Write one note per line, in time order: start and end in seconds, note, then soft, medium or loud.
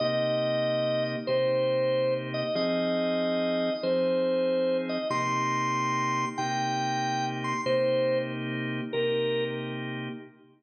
0.00 1.16 C3 medium
0.00 1.16 A#3 medium
0.00 1.16 D#4 medium
0.00 1.16 G4 medium
0.00 1.03 D#5 loud
1.27 2.43 C3 medium
1.27 2.43 A#3 medium
1.27 2.43 D#4 medium
1.27 2.43 G4 medium
1.27 2.14 C5 loud
2.34 2.55 D#5 medium
2.55 3.70 F3 loud
2.55 3.70 C4 loud
2.55 3.70 D#4 medium
2.55 3.70 G#4 medium
2.55 3.73 D#5 loud
3.83 4.98 F3 medium
3.83 4.98 C4 medium
3.83 4.98 D#4 medium
3.83 4.98 G#4 medium
3.83 4.77 C5 loud
4.89 5.08 D#5 medium
5.10 6.25 C3 medium
5.10 6.25 A#3 medium
5.10 6.25 D#4 medium
5.10 6.25 G4 loud
5.10 6.25 C6 loud
6.38 7.53 C3 medium
6.38 7.53 A#3 medium
6.38 7.53 D#4 medium
6.38 7.53 G4 medium
6.38 7.26 G5 medium
7.44 7.61 C6 medium
7.66 8.81 C3 medium
7.66 8.81 A#3 loud
7.66 8.81 D#4 loud
7.66 8.81 G4 medium
7.66 8.18 C5 loud
8.93 10.09 C3 medium
8.93 10.09 A#3 medium
8.93 10.09 D#4 medium
8.93 10.09 G4 medium
8.93 9.44 A#4 medium